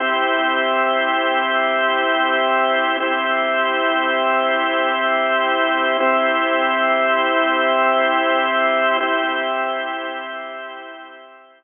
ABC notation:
X:1
M:3/4
L:1/8
Q:1/4=60
K:Cmix
V:1 name="Drawbar Organ"
[CEG]6 | [CEG]6 | [CEG]6 | [CEG]6 |]